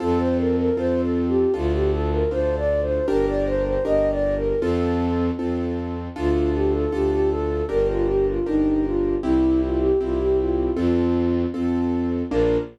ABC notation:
X:1
M:2/4
L:1/16
Q:1/4=78
K:Bb
V:1 name="Flute"
A c B B (3c2 A2 G2 | F G A B (3c2 d2 c2 | B d c c (3e2 d2 B2 | A4 z4 |
F2 G A G G A2 | B F G F E2 F2 | =E2 F G F G F2 | F4 z4 |
B4 z4 |]
V:2 name="Acoustic Grand Piano"
[CFA]4 [CFA]4 | [DFA]4 [DFA]4 | [DGB]4 [DGB]4 | [CFA]4 [CFA]4 |
[DFA]4 [DFA]4 | [DGB]4 [DGB]4 | [C=EG]4 [CEG]4 | [CFA]4 [CFA]4 |
[B,DF]4 z4 |]
V:3 name="Violin" clef=bass
F,,4 F,,4 | D,,4 D,,4 | G,,,4 G,,,4 | F,,4 F,,4 |
D,,4 D,,4 | G,,,4 G,,,4 | C,,4 C,,4 | F,,4 F,,4 |
B,,,4 z4 |]